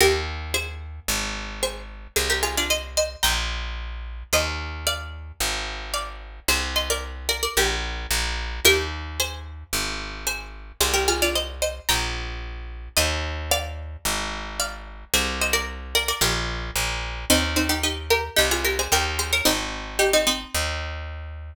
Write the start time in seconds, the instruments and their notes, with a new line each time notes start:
0.00 electric bass (finger) D#2, pizzicato strings G4 A#4
0.54 pizzicato strings G#4 C5
1.08 electric bass (finger) G#1
1.63 pizzicato strings G#4 C5
2.16 electric bass (finger) C2, pizzicato strings G#4 C5
2.30 pizzicato strings G4 A#4
2.43 pizzicato strings F4 G#4
2.57 pizzicato strings D4 F4
2.70 pizzicato strings C5 D#5
2.97 pizzicato strings C5 D#5
3.23 electric bass (finger) A#1, pizzicato strings G5 A#5
4.33 electric bass (finger) D#2, pizzicato strings C5 D#5
4.87 pizzicato strings D5 F5
5.40 electric bass (finger) G#1
5.94 pizzicato strings D5 F5
6.48 electric bass (finger) C2, pizzicato strings G#4 C5
6.76 pizzicato strings C5 D#5
6.90 pizzicato strings A#4 D5
7.29 pizzicato strings A#4 D5
7.43 pizzicato strings A#4 D5
7.57 electric bass (finger) A#1, pizzicato strings G4 A#4
8.11 electric bass (finger) A#1
8.65 electric bass (finger) D#2, pizzicato strings G4 A#4
9.20 pizzicato strings G#4 C5
9.73 electric bass (finger) G#1
10.27 pizzicato strings G#4 C5
10.81 electric bass (finger) C2, pizzicato strings G#4 C5
10.94 pizzicato strings G4 A#4
11.08 pizzicato strings F4 G#4
11.22 pizzicato strings D4 F4
11.35 pizzicato strings C5 D#5
11.62 pizzicato strings C5 D#5
11.89 electric bass (finger) A#1, pizzicato strings G5 A#5
12.97 electric bass (finger) D#2, pizzicato strings C5 D#5
13.51 pizzicato strings D5 F5
14.05 electric bass (finger) G#1
14.60 pizzicato strings D5 F5
15.14 electric bass (finger) C2, pizzicato strings G#4 C5
15.41 pizzicato strings C5 D#5
15.53 pizzicato strings A#4 D5
15.95 pizzicato strings A#4 D5
16.08 pizzicato strings A#4 D5
16.21 electric bass (finger) A#1, pizzicato strings G4 A#4
16.76 electric bass (finger) A#1
17.30 electric bass (finger) D#2, pizzicato strings C4 D#4
17.56 pizzicato strings C4 D#4
17.69 pizzicato strings D#4 G4
17.83 pizzicato strings D#4 G4
18.10 pizzicato strings G4 A#4
18.36 electric bass (finger) C2, pizzicato strings D#4 G4
18.51 pizzicato strings F4 G#4
18.65 pizzicato strings G4 A#4
18.79 pizzicato strings G#4 C5
18.92 electric bass (finger) D#2, pizzicato strings G4 A#4
19.19 pizzicato strings G#4 C5
19.33 pizzicato strings A#4 C#5
19.45 electric bass (finger) G#1, pizzicato strings C4 D#4
19.99 pizzicato strings D#4 G4
20.13 pizzicato strings C4 D#4
20.27 pizzicato strings C4 D#4
20.55 electric bass (finger) D#2